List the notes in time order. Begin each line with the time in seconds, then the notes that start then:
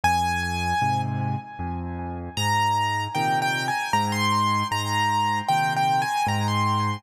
0.04 F2 G#5
0.81 G#2 C3
1.59 F2
2.37 G#2 A#5
3.15 A#2 C3 D#3 G5
3.42 G5
3.68 G#5
3.93 G#2 A#5
4.12 C6
4.71 G#2 A#5
5.48 A#2 C3 D#3 G5
5.76 G5
6.02 G#5
6.27 G#2 A#5
6.48 C6